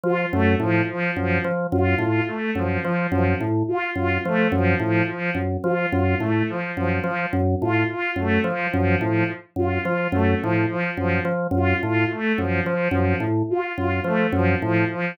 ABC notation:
X:1
M:9/8
L:1/8
Q:3/8=71
K:none
V:1 name="Drawbar Organ" clef=bass
F, _G,, A,, z G,, F, G,, A,, z | _G,, F, G,, A,, z G,, F, G,, A,, | z _G,, F, G,, A,, z G,, F, G,, | A,, z _G,, F, G,, A,, z G,, F, |
_G,, A,, z G,, F, G,, A,, z G,, | F, _G,, A,, z G,, F, G,, A,, z |]
V:2 name="Violin"
F A, F, F, F, z F F A, | F, F, F, z F F A, F, F, | F, z F F A, F, F, F, z | F F A, F, F, F, z F F |
A, F, F, F, z F F A, F, | F, F, z F F A, F, F, F, |]